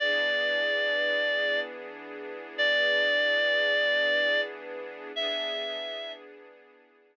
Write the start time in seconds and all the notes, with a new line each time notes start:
0.00 E3 B3 D4 G#4 D5
2.58 D5
5.16 E3 B3 D4 G#4 E5